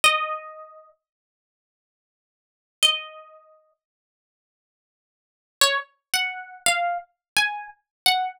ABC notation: X:1
M:4/4
L:1/16
Q:1/4=86
K:Db
V:1 name="Acoustic Guitar (steel)"
e6 z10 | e6 z10 | d z2 g3 f2 z2 a2 z2 g2 |]